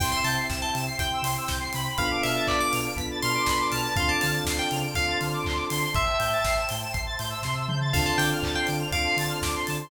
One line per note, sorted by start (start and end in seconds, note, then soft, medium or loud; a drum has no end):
0.00 0.13 C2 medium
0.00 0.89 C4 medium
0.00 0.89 E4 medium
0.00 0.89 G4 medium
0.00 0.98 C5 medium
0.00 0.98 E5 medium
0.00 0.12 G5 medium
0.00 0.98 G5 medium
0.00 0.12 C6 medium
0.00 kick loud
0.00 crash loud
0.12 0.24 C6 medium
0.12 0.24 E6 medium
0.24 0.38 C3 medium
0.24 0.36 A5 medium
0.24 0.36 G6 medium
0.24 open hi-hat medium
0.36 0.47 C7 medium
0.49 0.63 C2 medium
0.49 0.61 E7 medium
0.49 kick loud
0.49 snare loud
0.61 0.74 A5 medium
0.61 0.73 G7 medium
0.74 0.88 C3 medium
0.74 0.85 E7 medium
0.74 open hi-hat medium
0.86 0.98 C7 medium
0.99 1.12 C2 medium
0.99 1.88 C4 medium
0.99 1.88 E4 medium
0.99 1.88 G4 medium
0.99 1.97 C5 medium
0.99 1.97 G5 medium
0.99 1.24 G5 medium
0.99 1.97 C6 medium
0.99 1.10 G6 medium
0.99 kick loud
0.99 closed hi-hat loud
1.14 1.25 E6 medium
1.22 1.36 C3 medium
1.22 1.35 C6 medium
1.22 open hi-hat loud
1.38 1.49 E6 medium
1.48 1.63 C2 medium
1.48 1.60 G6 medium
1.48 kick loud
1.48 snare loud
1.60 1.71 C7 medium
1.73 1.88 C3 medium
1.73 2.10 B5 loud
1.73 open hi-hat loud
1.98 2.12 B1 medium
1.98 2.88 B3 medium
1.98 2.88 D4 medium
1.98 2.88 F4 medium
1.98 2.88 A4 medium
1.98 2.96 B4 medium
1.98 2.96 D5 medium
1.98 2.96 F5 medium
1.98 2.22 F5 medium
1.98 2.96 A5 medium
1.98 kick loud
1.98 closed hi-hat loud
2.11 2.22 D6 medium
2.23 2.38 B2 medium
2.23 2.46 E5 medium
2.23 2.35 F6 medium
2.23 open hi-hat medium
2.36 2.47 A6 medium
2.47 2.63 B1 medium
2.47 2.60 D5 medium
2.47 2.58 B6 medium
2.47 kick loud
2.47 clap loud
2.60 2.72 D6 medium
2.60 2.72 D7 medium
2.72 2.87 B2 medium
2.72 2.83 F7 medium
2.72 open hi-hat loud
2.85 2.96 D7 medium
2.96 3.10 B1 medium
2.96 3.87 B3 medium
2.96 3.87 D4 medium
2.96 3.87 F4 medium
2.96 3.87 A4 medium
2.96 3.96 B4 medium
2.96 3.96 D5 medium
2.96 3.96 A5 medium
2.96 3.96 B5 medium
2.96 3.08 B6 medium
2.96 kick loud
2.96 closed hi-hat loud
3.11 3.22 A6 medium
3.22 3.37 B2 medium
3.22 3.66 C6 medium
3.22 3.33 F6 medium
3.22 open hi-hat medium
3.35 3.46 D6 medium
3.46 3.61 B1 medium
3.46 3.59 B5 medium
3.46 kick medium
3.46 snare loud
3.60 3.71 D6 medium
3.70 3.86 B2 medium
3.70 3.93 A5 medium
3.70 3.81 F6 medium
3.70 open hi-hat loud
3.84 3.95 A6 medium
3.96 4.11 D2 medium
3.96 4.86 C4 medium
3.96 4.86 D4 medium
3.96 4.86 F4 medium
3.96 4.86 A4 medium
3.96 4.95 C5 medium
3.96 4.95 D5 medium
3.96 4.08 F5 medium
3.96 4.95 F5 medium
3.96 4.95 A5 medium
3.96 4.09 C6 medium
3.96 kick loud
3.96 closed hi-hat loud
4.08 4.21 A5 medium
4.08 4.20 D6 medium
4.20 4.37 D3 medium
4.20 4.33 A5 medium
4.20 4.31 F6 medium
4.20 open hi-hat loud
4.33 4.45 A6 medium
4.45 4.58 D2 medium
4.45 4.58 C7 medium
4.45 kick medium
4.45 snare loud
4.59 4.71 G5 medium
4.59 4.71 D7 medium
4.71 4.85 C#3 medium
4.71 4.82 F7 medium
4.71 open hi-hat medium
4.83 4.94 D7 medium
4.95 5.10 D2 medium
4.95 5.85 C4 medium
4.95 5.85 D4 medium
4.95 5.85 F4 medium
4.95 5.85 A4 medium
4.95 5.94 C5 medium
4.95 5.94 D5 medium
4.95 5.18 F5 medium
4.95 5.94 A5 medium
4.95 5.94 C6 medium
4.95 5.06 C7 medium
4.95 kick loud
4.95 closed hi-hat loud
5.08 5.19 A6 medium
5.21 5.35 D3 medium
5.21 5.32 F6 medium
5.21 open hi-hat medium
5.33 5.44 D6 medium
5.44 5.60 D2 medium
5.44 5.57 C6 medium
5.44 kick loud
5.44 clap loud
5.56 5.67 D6 medium
5.69 5.84 D3 medium
5.69 6.05 C6 medium
5.69 open hi-hat loud
5.94 6.08 A1 medium
5.94 6.93 C5 medium
5.94 6.93 E5 medium
5.94 6.62 E5 medium
5.94 6.93 G5 medium
5.94 6.93 A5 medium
5.94 kick loud
5.94 closed hi-hat loud
6.06 6.17 E6 medium
6.19 6.33 A2 medium
6.19 6.30 G6 medium
6.19 open hi-hat medium
6.33 6.44 A6 medium
6.44 6.58 A1 medium
6.44 6.57 C7 medium
6.44 kick loud
6.44 snare loud
6.57 6.68 E7 medium
6.68 6.84 A2 medium
6.68 6.79 G7 medium
6.68 open hi-hat loud
6.82 6.94 E7 medium
6.92 7.08 A1 medium
6.92 7.93 C5 medium
6.92 7.93 E5 medium
6.92 7.93 A5 medium
6.92 7.93 C6 medium
6.92 7.03 C7 medium
6.92 kick loud
6.92 closed hi-hat loud
7.07 7.18 A6 medium
7.18 7.33 A2 medium
7.18 7.30 G6 medium
7.18 open hi-hat medium
7.30 7.41 E6 medium
7.43 7.67 C3 medium
7.43 7.55 C6 medium
7.43 kick medium
7.43 snare loud
7.54 7.65 E6 medium
7.68 7.92 C#3 medium
7.68 7.79 G6 medium
7.68 mid tom loud
7.81 7.92 A6 medium
7.91 8.07 D2 medium
7.91 8.83 C4 medium
7.91 8.83 D4 medium
7.91 8.83 F4 medium
7.91 8.83 A4 medium
7.91 8.91 C5 medium
7.91 8.91 D5 medium
7.91 8.05 F5 medium
7.91 8.92 F5 medium
7.91 8.03 A5 medium
7.91 8.91 A5 medium
7.91 kick loud
7.91 crash loud
8.06 8.18 A5 medium
8.06 8.17 C6 medium
8.18 8.31 D3 medium
8.18 8.30 G5 medium
8.18 8.29 D6 medium
8.18 open hi-hat loud
8.33 8.44 F6 medium
8.43 8.56 D2 medium
8.43 8.55 A6 medium
8.43 kick loud
8.43 clap loud
8.55 8.67 G5 medium
8.55 8.67 C7 medium
8.67 8.82 D3 medium
8.67 8.79 D7 medium
8.67 open hi-hat medium
8.78 8.90 F7 medium
8.91 9.05 D2 medium
8.91 9.82 C4 medium
8.91 9.82 D4 medium
8.91 9.82 F4 medium
8.91 9.82 A4 medium
8.91 9.90 C5 medium
8.91 9.90 D5 medium
8.91 9.16 F5 medium
8.91 9.90 A5 medium
8.91 9.90 C6 medium
8.91 9.04 D7 medium
8.91 kick loud
8.91 closed hi-hat loud
9.06 9.17 C7 medium
9.17 9.30 D3 medium
9.17 9.30 A6 medium
9.17 open hi-hat loud
9.29 9.41 F6 medium
9.42 9.55 D2 medium
9.42 9.54 D6 medium
9.42 kick loud
9.42 snare loud
9.55 9.66 C6 medium
9.66 9.82 D3 medium
9.66 9.77 A5 medium
9.66 open hi-hat loud
9.81 9.90 C6 medium